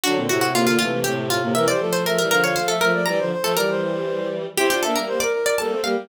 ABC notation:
X:1
M:3/4
L:1/16
Q:1/4=119
K:F
V:1 name="Harpsichord"
^F2 F F =F F F2 G2 F2 | e d2 c B B B ^c =c A B2 | b3 A B4 z4 | G G A B z d2 d a2 f2 |]
V:2 name="Ocarina"
D C E2 B,2 A, A, A, A,2 B, | B c A2 e2 f f f e2 d | d c c2 d c c4 z2 | c c e2 c B B2 A2 G2 |]
V:3 name="Violin"
[D,^F,] [B,,D,] [A,,C,]2 [A,,C,] [B,,D,] [C,E,]2 [A,,C,]2 [A,,C,] [A,,C,] | [C,E,] [E,G,] [F,A,]2 [F,A,] [E,G,] [D,F,]2 [F,A,]2 [F,A,] [F,A,] | [E,G,] [D,F,] z [F,A,] [E,G,]8 | [CE] [DF] [B,D] [G,B,]2 z3 [G,B,] [A,C] [G,B,] [G,B,] |]